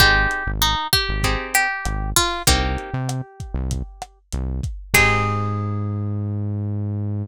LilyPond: <<
  \new Staff \with { instrumentName = "Acoustic Guitar (steel)" } { \time 4/4 \key aes \major \tempo 4 = 97 g'4 ees'8 g'4 g'4 f'8 | g'2. r4 | aes'1 | }
  \new Staff \with { instrumentName = "Acoustic Guitar (steel)" } { \time 4/4 \key aes \major <c' ees' g' aes'>2 <c' ees' g' aes'>2 | <bes c' ees' g'>1 | <c' ees' g' aes'>1 | }
  \new Staff \with { instrumentName = "Synth Bass 1" } { \clef bass \time 4/4 \key aes \major aes,,8. aes,,4 aes,,4~ aes,,16 aes,,4 | c,8. c4 c,4~ c,16 c,4 | aes,1 | }
  \new DrumStaff \with { instrumentName = "Drums" } \drummode { \time 4/4 <hh bd ss>8 hh8 hh8 <hh bd ss>8 <hh bd>8 hh8 <hh ss>8 <hho bd>8 | <hh bd>8 hh8 <hh ss>8 <hh bd>8 <hh bd>8 <hh ss>8 hh8 <hh bd>8 | <cymc bd>4 r4 r4 r4 | }
>>